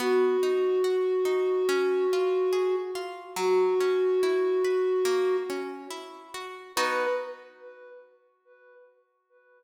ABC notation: X:1
M:4/4
L:1/8
Q:1/4=71
K:B
V:1 name="Flute"
F8 | F5 z3 | B2 z6 |]
V:2 name="Orchestral Harp"
B, D F D C ^E G E | F, C E B A, C E F | [B,DF]2 z6 |]